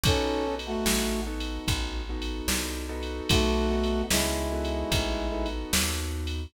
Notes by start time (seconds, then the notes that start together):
0.03 B1 B3 C#4 D#4 F#4 A4, kick, ride
0.47 B3 D#4 F#4 A4
0.59 ride
0.66 A3 F#4
0.86 A1, snare
1.27 B3 D#4 F#4 A4
1.40 ride
1.68 A1, kick, ride
2.09 B3 D#4 F#4 A4
2.22 ride
2.48 C2, snare
2.89 B3 D#4 F#4 A4
3.03 ride
3.29 B1 A3 F#4, kick, ride
3.71 B3 D#4 F#4 A4
3.83 ride
4.10 C#2 G#3 E4, snare
4.52 B3 D#4 F#4 A4
4.65 ride
4.92 A1, kick, ride
5.31 B3 D#4 F#4 A4
5.46 ride
5.73 D#2, snare
6.27 ride